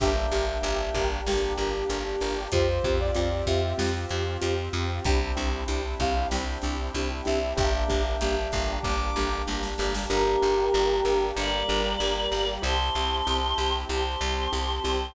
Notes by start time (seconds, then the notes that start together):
0.00 G1 A#3 D4 G4 A#4 E5 G5, kick, crash
0.31 G1 D4 G4 A#4, closed hi-hat
0.62 G1 D4 G4 A#4, closed hi-hat
0.94 G1 D4 G4 A#4, kick, closed hi-hat
1.26 G1 D4 G4 A#4, snare
1.58 G1 D4 G4 A#4, closed hi-hat
1.89 G1 D4 G4 A#4, closed hi-hat
2.21 G1 D4 G4 A#4, open hi-hat
2.52 F2 C4 F4 G4 C5, kick, closed hi-hat
2.84 F2 C4 F4 G4, kick, closed hi-hat
3.00 D5
3.15 F2 C4 F4 G4, closed hi-hat
3.46 F2 C4 F4 G4 E5, kick, closed hi-hat
3.78 F2 C4 F4 G4, snare
4.09 F2 C4 F4 G4, closed hi-hat
4.41 F2 C4 F4 G4, closed hi-hat
4.73 F2 C4 F4 G4, closed hi-hat
5.04 C2 C4 D4 E4 G4 G5, kick, closed hi-hat
5.37 C2 C4 D4 E4 G4, closed hi-hat
5.68 C2 C4 D4 E4 G4, closed hi-hat
6.00 C2 C4 D4 E4 G4 F5, kick, closed hi-hat
6.31 C2 C4 D4 E4 G4 G5, snare
6.62 C2 C4 D4 E4 G4, closed hi-hat
6.94 C2 C4 D4 E4 G4, closed hi-hat
7.25 C2 C4 D4 E4 G4 E5, closed hi-hat
7.57 G1 A#3 D4 G4 E5 G5, kick, closed hi-hat
7.89 G1 A#3 D4 G4, kick, closed hi-hat
8.21 G1 A#3 D4 G4, closed hi-hat
8.52 G1 A#3 D4 G4, kick, closed hi-hat
8.83 G1 A#3 D4 G4 D6, kick, snare
9.16 G1 A#3 D4 G4, snare
9.47 G1 A#3 D4 G4, snare
9.63 snare
9.78 G1 A#3 D4 G4, snare
9.95 snare
10.10 G1 A#3 D4 G4 A#4
10.42 G1 D4 G4 A#4
10.73 G1 D4 G4 A#4
11.05 G1 D4 G4 A#4
11.36 G1 G3 A#3 D4 G4 A#4 D5
11.68 G1 D4 G4 A#4
11.99 G1 D4 G4 A#4
12.31 G1 D4 G4 A#4
12.62 C2 C4 E4 G4 A5 C6
12.95 C2 C4 E4 G4
13.26 C2 C4 E4 G4
13.58 C2 C4 E4 G4
13.89 C2 C4 E4 G4 C5 A5 C6
14.21 C2 C4 E4 G4
14.52 C2 C4 E4 G4
14.84 C2 C4 E4 G4